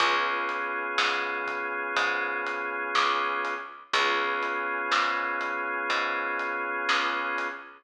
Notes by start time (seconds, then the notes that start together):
0.00 C#2 B3 C#4 F4 G#4, kick, closed hi-hat
0.49 closed hi-hat
0.98 G#2, snare
1.47 kick, closed hi-hat
1.97 G#2, kick, closed hi-hat
2.47 closed hi-hat
2.95 C#2, snare
3.45 closed hi-hat
3.93 C#2 B3 C#4 F4 G#4, kick, closed hi-hat
4.43 closed hi-hat
4.91 G#2, snare
5.41 closed hi-hat
5.90 G#2, kick, closed hi-hat
6.39 closed hi-hat
6.89 C#2, snare
7.38 closed hi-hat